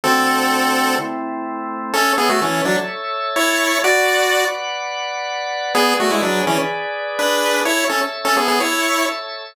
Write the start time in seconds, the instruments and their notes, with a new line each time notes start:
0.04 drawbar organ D3 A3 F#4, lead 1 (square) C4 A4
0.99 drawbar organ A3 C4 E4
1.93 lead 1 (square) C#4 A4, drawbar organ A4 C#5 E5
2.18 lead 1 (square) B3 G#4
2.29 lead 1 (square) A3 F#4
2.41 lead 1 (square) E3 C#4
2.65 lead 1 (square) F#3 D4
3.36 lead 1 (square) E4 C#5
3.84 lead 1 (square) F#4 D5, drawbar organ B4 D5 F#5
5.75 lead 1 (square) B3 G#4, drawbar organ G#4 B4 D5
6.00 lead 1 (square) A3 F#4
6.10 lead 1 (square) G#3 E4
6.22 lead 1 (square) F#3 D4
6.47 lead 1 (square) E3 C#4
7.19 lead 1 (square) D4 B4
7.65 lead 1 (square) E4 C#5, drawbar organ A4 C#5 E5
7.89 lead 1 (square) C#4 A4
8.25 lead 1 (square) C#4 A4
8.37 lead 1 (square) B3 G#4
8.48 lead 1 (square) B3 G#4
8.60 lead 1 (square) E4 C#5